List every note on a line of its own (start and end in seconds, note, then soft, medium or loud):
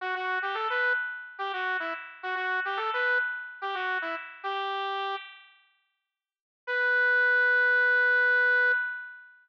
0.01 0.14 F#4 loud
0.15 0.38 F#4 loud
0.42 0.55 G4 medium
0.54 0.68 A4 medium
0.70 0.93 B4 medium
1.39 1.52 G4 medium
1.53 1.77 F#4 medium
1.80 1.93 E4 medium
2.23 2.35 F#4 loud
2.35 2.60 F#4 medium
2.65 2.78 G4 medium
2.77 2.90 A4 medium
2.94 3.18 B4 loud
3.62 3.75 G4 medium
3.75 3.98 F#4 medium
4.02 4.15 E4 loud
4.44 5.15 G4 loud
6.67 8.72 B4 loud